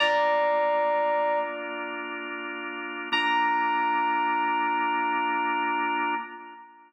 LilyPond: <<
  \new Staff \with { instrumentName = "Electric Piano 2" } { \time 4/4 \key bes \major \tempo 4 = 77 <d'' bes''>2 r2 | bes''1 | }
  \new Staff \with { instrumentName = "Drawbar Organ" } { \time 4/4 \key bes \major <bes d' f'>1 | <bes d' f'>1 | }
>>